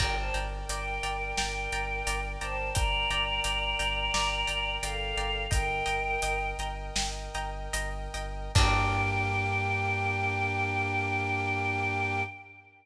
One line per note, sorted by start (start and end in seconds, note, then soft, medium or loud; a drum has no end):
0.00 0.29 G1 loud
0.00 0.14 A#4 medium
0.00 5.46 A#4 medium
0.00 5.46 D5 medium
0.00 0.14 D5 medium
0.00 0.14 G5 medium
0.00 5.46 G5 medium
0.00 0.14 G5 medium
0.00 0.14 A#5 medium
0.00 kick medium
0.00 crash medium
0.18 0.35 C5 medium
0.18 0.35 A5 medium
0.34 0.64 G1 medium
0.34 0.48 D5 medium
0.34 0.48 G5 medium
0.34 0.48 A#5 medium
0.34 closed hi-hat medium
0.69 0.98 G1 medium
0.69 1.36 A#4 medium
0.69 0.84 D5 medium
0.69 1.36 G5 medium
0.69 0.84 G5 medium
0.69 0.84 A#5 medium
0.69 closed hi-hat medium
1.03 1.32 G1 medium
1.03 1.17 D5 medium
1.03 1.17 G5 medium
1.03 1.17 A#5 medium
1.03 closed hi-hat medium
1.37 1.67 G1 medium
1.37 2.25 A#4 medium
1.37 1.52 D5 medium
1.37 1.52 G5 medium
1.37 2.25 G5 medium
1.37 1.52 A#5 medium
1.37 snare medium
1.72 2.02 G1 medium
1.72 1.86 D5 medium
1.72 1.86 G5 medium
1.72 1.86 A#5 medium
1.72 closed hi-hat medium
2.07 2.36 G1 medium
2.07 2.21 D5 medium
2.07 2.21 G5 medium
2.07 2.21 A#5 medium
2.07 closed hi-hat medium
2.40 2.71 G1 medium
2.40 2.70 C5 medium
2.40 2.55 D5 medium
2.40 2.55 G5 medium
2.40 2.70 A5 medium
2.40 2.55 A#5 medium
2.40 closed hi-hat medium
2.75 3.05 G1 medium
2.75 2.89 D5 medium
2.75 4.73 D5 medium
2.75 2.89 G5 medium
2.75 2.89 A#5 medium
2.75 4.73 A#5 medium
2.75 kick medium
2.75 closed hi-hat medium
3.10 3.40 G1 medium
3.10 3.25 D5 medium
3.10 3.25 G5 medium
3.10 3.25 A#5 medium
3.10 closed hi-hat medium
3.44 3.74 G1 medium
3.44 3.58 D5 medium
3.44 3.58 G5 medium
3.44 3.58 A#5 medium
3.44 closed hi-hat medium
3.79 4.09 G1 medium
3.79 3.93 D5 medium
3.79 3.93 G5 medium
3.79 3.93 A#5 medium
3.79 closed hi-hat medium
4.14 4.43 G1 medium
4.14 4.28 D5 medium
4.14 4.28 G5 medium
4.14 4.28 A#5 medium
4.14 snare medium
4.47 4.78 G1 medium
4.47 4.61 D5 medium
4.47 4.61 G5 medium
4.47 4.61 A#5 medium
4.47 closed hi-hat medium
4.81 5.12 G1 medium
4.81 5.43 A4 medium
4.81 4.97 D5 medium
4.81 5.43 F5 medium
4.81 4.97 G5 medium
4.81 4.97 A#5 medium
4.81 closed hi-hat medium
5.17 5.47 G1 medium
5.17 5.31 D5 medium
5.17 5.31 G5 medium
5.17 5.31 A#5 medium
5.17 closed hi-hat soft
5.50 5.82 G1 loud
5.50 6.45 A#4 medium
5.50 8.52 A#4 medium
5.50 5.65 D#5 medium
5.50 8.52 D#5 medium
5.50 6.45 G5 medium
5.50 5.65 G5 medium
5.50 8.52 G5 medium
5.50 5.65 A#5 medium
5.50 kick medium
5.50 closed hi-hat medium
5.86 6.17 G1 medium
5.86 6.00 D#5 medium
5.86 6.00 G5 medium
5.86 6.00 A#5 medium
5.86 closed hi-hat medium
6.22 6.54 G1 medium
6.22 6.37 D#5 medium
6.22 6.37 G5 medium
6.22 6.37 A#5 medium
6.22 closed hi-hat medium
6.59 6.90 G1 medium
6.59 6.74 D#5 medium
6.59 6.74 G5 medium
6.59 6.74 A#5 medium
6.59 closed hi-hat medium
6.96 7.29 G1 medium
6.96 7.11 D#5 medium
6.96 7.11 G5 medium
6.96 7.11 A#5 medium
6.96 snare medium
7.34 7.68 G1 medium
7.34 7.50 D#5 medium
7.34 7.50 G5 medium
7.34 7.50 A#5 medium
7.34 closed hi-hat medium
7.73 8.08 G1 medium
7.73 7.89 D#5 medium
7.73 7.89 G5 medium
7.73 7.89 A#5 medium
7.73 closed hi-hat medium
8.14 8.49 G1 medium
8.14 8.30 D#5 medium
8.14 8.30 G5 medium
8.14 8.30 A#5 medium
8.14 closed hi-hat medium
8.55 12.22 G2 loud
8.55 12.23 A#3 loud
8.55 12.22 D4 loud
8.55 12.23 D4 loud
8.55 12.22 G4 loud
8.55 12.23 G4 loud
8.55 12.22 A#4 loud
8.55 12.22 G5 loud
8.55 kick loud
8.55 crash loud